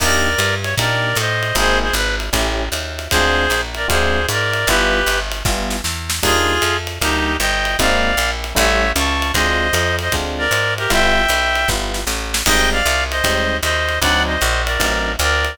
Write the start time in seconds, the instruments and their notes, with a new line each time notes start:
0.00 electric bass (finger) D#2, electric piano 1 A#3 D4 D#4 G4, clarinet A#4 D5, kick, crash, ride
0.38 electric bass (finger) G2, hi-hat pedal, ride
0.64 clarinet C#5, ride
0.78 electric bass (finger) A#2, electric piano 1 A#3 D4 D#4 G4, clarinet A#4 D5, kick, ride
1.16 electric bass (finger) A2, clarinet C5 D#5, hi-hat pedal, ride
1.43 ride
1.55 electric bass (finger) G#1, electric piano 1 A#3 C4 D#4 G#4, clarinet G#4 C5, kick, ride
1.82 clarinet G#4 C5
1.93 electric bass (finger) G#1, clarinet B4, hi-hat pedal, ride
2.20 ride
2.33 electric bass (finger) A1, electric piano 1 A3 C#4 E4 G4, kick, ride
2.72 electric bass (finger) D#2, hi-hat pedal, ride
2.99 ride
3.10 electric bass (finger) D2, electric piano 1 G#3 C4 D4 F4, clarinet G#4 C5, kick, ride
3.50 electric bass (finger) A#1, hi-hat pedal, ride
3.75 clarinet A#4 D5, ride
3.88 electric bass (finger) D2, electric piano 1 G#3 C4 D4 F4, clarinet G#4 C5, kick, ride
4.28 electric bass (finger) G#2, clarinet A#4 D5, hi-hat pedal, ride
4.53 ride
4.67 electric bass (finger) G1, electric piano 1 G3 B3 E4 F4, clarinet G4 B4, kick, ride
5.06 electric bass (finger) G1, hi-hat pedal, ride
5.32 ride
5.45 electric bass (finger) G1, electric piano 1 G3 B3 E4 F4, kick, snare
5.70 snare
5.84 electric bass (finger) E2, snare
6.10 snare
6.23 electric bass (finger) D#2, electric piano 1 G3 A#3 D4 D#4, clarinet F4 G#4, kick, crash, ride
6.62 electric bass (finger) F2, hi-hat pedal, ride
6.87 ride
7.01 electric bass (finger) D2, electric piano 1 G3 A#3 D4 D#4, clarinet D#4 G4, kick, ride
7.40 electric bass (finger) G1, clarinet D#5 G5, hi-hat pedal, ride
7.65 ride
7.79 electric bass (finger) G#1, electric piano 1 G#3 A#3 C4 D#4, clarinet D5 F5, kick, ride
8.17 electric bass (finger) A#1, hi-hat pedal, ride
8.44 ride
8.55 electric bass (finger) A1, electric piano 1 G3 A3 C#4 E4, clarinet C#5 E5, kick, ride
8.96 electric bass (finger) C#2, clarinet A5 C#6, hi-hat pedal, ride
9.22 ride
9.34 electric bass (finger) D2, electric piano 1 G#3 C4 D4 F4, clarinet C5 D#5, kick, ride
9.73 electric bass (finger) F2, hi-hat pedal, ride
9.99 clarinet C5 D#5, ride
10.12 electric bass (finger) D2, electric piano 1 G#3 C4 D4 F4, kick, ride
10.38 clarinet A#4 D5
10.51 electric bass (finger) G#2, hi-hat pedal, ride
10.78 clarinet G4 A#4, ride
10.90 electric bass (finger) G1, electric piano 1 G3 B3 E4 F4, clarinet E5 G5, kick, ride
11.29 electric bass (finger) B1, hi-hat pedal, ride
11.55 ride
11.68 electric bass (finger) G1, electric piano 1 G3 B3 E4 F4, kick, snare
11.94 snare
12.07 electric bass (finger) A1, snare
12.34 snare
12.46 electric bass (finger) G#1, electric piano 1 G3 G#3 C4 D#4, clarinet D#5 G5, kick, crash, ride
12.72 clarinet D5 F5
12.86 electric bass (finger) C2, hi-hat pedal, ride
13.11 clarinet C5 D#5, ride
13.24 electric bass (finger) D#2, electric piano 1 G3 G#3 C4 D#4, kick, ride
13.63 electric bass (finger) D#2, clarinet C5 D#5, hi-hat pedal, ride
13.89 ride
14.02 electric bass (finger) D2, electric piano 1 F#3 C4 D4 D#4, clarinet D5 F#5, kick, ride
14.27 clarinet C5 D#5
14.41 electric bass (finger) A#1, hi-hat pedal, ride
14.66 clarinet A#4 D5, ride
14.80 electric bass (finger) A1, electric piano 1 F#3 C4 D4 D#4, kick, ride
15.19 electric bass (finger) D2, clarinet A#4 D5, hi-hat pedal, ride
15.45 ride